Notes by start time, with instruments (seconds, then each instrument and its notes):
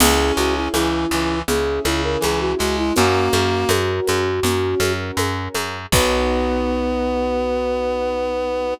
0.00 electric bass (finger) C#2, acoustic grand piano C#4 E4 G#4, clarinet C#4, flute G#4, crash, low conga, shaker
0.37 electric bass (finger) C#2, flute F#4, shaker
0.56 flute E4
0.73 electric bass (finger) C#2, clarinet E3, flute E4, high conga, shaker
1.11 electric bass (finger) C#2, clarinet E3, shaker
1.48 electric bass (finger) C#2, acoustic grand piano C#4 E4 G#4, flute G#4, low conga, shaker
1.84 electric bass (finger) C#2, clarinet C#3, flute E4, high conga, shaker
2.04 flute A#4
2.20 electric bass (finger) C#2, clarinet E3, flute G#4, high conga, shaker
2.40 flute F#4
2.58 electric bass (finger) C#2, clarinet G#3, flute F#4, shaker
2.78 flute E4
2.96 electric bass (finger) F#2, clarinet A#3, acoustic grand piano C#4 F#4 A#4, flute F#4, low conga, shaker
3.32 electric bass (finger) F#2, high conga, shaker
3.69 electric bass (finger) F#2, high conga, shaker
4.07 electric bass (finger) F#2, high conga, shaker
4.43 electric bass (finger) F#2, acoustic grand piano C#4 F#4 A#4, low conga, shaker
4.80 electric bass (finger) F#2, high conga, shaker
5.17 electric bass (finger) F#2, high conga, shaker
5.54 electric bass (finger) F#2, high conga, shaker
5.92 electric bass (finger) B1, acoustic grand piano B3 D#4 F#4, clarinet B3, flute B4, kick, crash